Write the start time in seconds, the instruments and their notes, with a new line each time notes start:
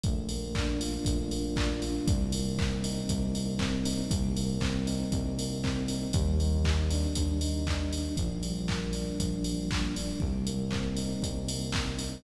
0.03 synth bass 1 A#1, electric piano 1 A3, kick, closed hi-hat
0.29 electric piano 1 A#3, open hi-hat
0.55 electric piano 1 D4, kick, clap
0.80 electric piano 1 F4, open hi-hat
1.05 synth bass 1 A#1, electric piano 1 A3, kick, closed hi-hat
1.31 electric piano 1 A#3, open hi-hat
1.56 electric piano 1 D4, kick, clap
1.82 electric piano 1 F4, open hi-hat
2.07 synth bass 1 C2, electric piano 1 G3, kick, closed hi-hat
2.32 electric piano 1 A#3, open hi-hat
2.58 electric piano 1 C4, kick, clap
2.84 electric piano 1 D#4, open hi-hat
3.09 synth bass 1 C2, electric piano 1 G3, kick, closed hi-hat
3.34 electric piano 1 A#3, open hi-hat
3.59 electric piano 1 C4, kick, clap
3.85 electric piano 1 D#4, open hi-hat
4.11 synth bass 1 C2, electric piano 1 G3, kick, closed hi-hat
4.36 electric piano 1 A#3, open hi-hat
4.60 electric piano 1 C4, kick, clap
4.87 electric piano 1 D#4, open hi-hat
5.12 synth bass 1 C2, electric piano 1 G3, kick, closed hi-hat
5.38 electric piano 1 A#3, open hi-hat
5.63 electric piano 1 C4, kick, clap
5.88 electric piano 1 D#4, open hi-hat
6.13 synth bass 1 D#2, electric piano 1 G3, kick, closed hi-hat
6.39 electric piano 1 D#4, open hi-hat
6.65 electric piano 1 G3, kick, clap
6.90 electric piano 1 D4, open hi-hat
7.15 synth bass 1 D#2, electric piano 1 G3, kick, closed hi-hat
7.41 electric piano 1 D#4, open hi-hat
7.67 electric piano 1 D4, kick, clap
7.92 electric piano 1 G3, open hi-hat
8.17 synth bass 1 A#1, electric piano 1 F3, kick, closed hi-hat
8.43 electric piano 1 G3, open hi-hat
8.68 electric piano 1 A#3, kick, clap
8.93 electric piano 1 D4, open hi-hat
9.19 synth bass 1 A#1, electric piano 1 F3, kick, closed hi-hat
9.44 electric piano 1 G3, open hi-hat
9.70 electric piano 1 A#3, kick, clap
9.95 electric piano 1 D4, open hi-hat
10.20 synth bass 1 C2, electric piano 1 G3, kick
10.46 electric piano 1 A#3, closed hi-hat
10.71 electric piano 1 C4, kick, clap
10.97 electric piano 1 D#4, open hi-hat
11.22 synth bass 1 C2, electric piano 1 G3, kick, closed hi-hat
11.48 electric piano 1 A#3, open hi-hat
11.72 electric piano 1 C4, kick, clap
11.99 electric piano 1 D#4, open hi-hat